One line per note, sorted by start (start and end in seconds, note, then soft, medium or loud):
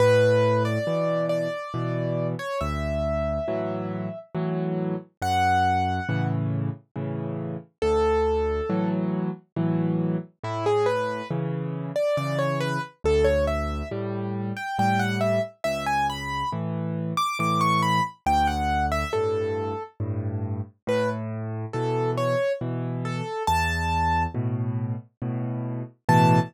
0.00 0.78 A2 loud
0.00 0.63 B4 loud
0.65 1.26 D5 medium
0.87 1.48 B2 medium
0.87 1.48 E3 medium
1.29 2.27 D5 medium
1.74 2.35 B2 medium
1.74 2.35 E3 medium
2.39 2.60 C#5 medium
2.61 3.39 D2 medium
2.61 4.19 E5 medium
3.48 4.09 A2 medium
3.48 4.09 E3 medium
3.48 4.09 F#3 medium
4.35 4.95 A2 medium
4.35 4.95 E3 medium
4.35 4.95 F#3 medium
5.22 6.00 F#2 medium
5.22 6.27 F#5 loud
6.09 6.70 A2 medium
6.09 6.70 C#3 medium
6.09 6.70 E3 medium
6.96 7.57 A2 medium
6.96 7.57 C#3 medium
6.96 7.57 E3 medium
7.82 8.61 D2 loud
7.82 8.89 A4 loud
8.70 9.30 A2 medium
8.70 9.30 E3 medium
8.70 9.30 F#3 medium
9.56 10.17 A2 medium
9.56 10.17 E3 medium
9.56 10.17 F#3 medium
10.43 11.22 A2 loud
10.43 10.65 E4 medium
10.66 10.87 G#4 medium
10.86 11.28 B4 medium
11.31 11.91 C#3 medium
11.31 11.91 E3 medium
11.96 12.16 D5 medium
12.17 12.78 C#3 medium
12.17 12.78 E3 medium
12.17 12.38 D5 medium
12.39 12.59 C#5 medium
12.61 12.81 B4 loud
13.04 13.83 D2 medium
13.04 13.26 A4 loud
13.24 13.45 C#5 medium
13.47 13.88 E5 medium
13.91 14.52 A2 medium
13.91 14.52 G3 medium
14.57 14.77 G5 medium
14.78 15.39 A2 medium
14.78 15.39 G3 medium
14.78 15.00 G5 medium
14.99 15.20 F#5 medium
15.21 15.41 E5 medium
15.64 16.43 C#2 medium
15.64 15.85 E5 loud
15.86 16.07 G#5 medium
16.10 16.50 B5 medium
16.52 17.13 A2 medium
16.52 17.13 E3 medium
17.17 17.38 D6 loud
17.39 18.00 A2 medium
17.39 18.00 E3 medium
17.39 17.61 D6 medium
17.61 17.81 C#6 medium
17.82 18.03 B5 medium
18.26 19.04 D2 loud
18.26 18.47 G5 medium
18.47 18.86 F#5 medium
18.92 19.12 E5 loud
19.13 19.74 G2 medium
19.13 19.74 A2 medium
19.13 19.83 A4 medium
20.00 20.61 G2 medium
20.00 20.61 A2 medium
20.87 21.65 A2 loud
20.87 21.09 B4 medium
21.73 22.35 B2 medium
21.73 22.35 E3 medium
21.73 22.11 A4 medium
22.17 22.53 C#5 medium
22.61 23.22 B2 medium
22.61 23.22 E3 medium
23.05 23.43 A4 medium
23.47 24.26 E2 loud
23.47 24.23 A5 loud
24.34 24.95 A2 medium
24.34 24.95 B2 medium
25.22 25.83 A2 medium
25.22 25.83 B2 medium
26.09 26.39 A2 loud
26.09 26.39 B2 loud
26.09 26.39 E3 loud
26.09 26.39 A5 loud